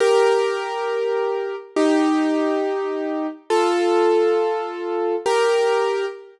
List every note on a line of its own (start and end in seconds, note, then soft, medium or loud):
0.00 1.56 G4 loud
0.00 1.56 A#4 loud
1.76 3.27 D#4 medium
1.76 3.27 G4 loud
3.50 5.15 F4 loud
3.50 5.15 A4 loud
5.26 6.05 G4 loud
5.26 6.05 A#4 loud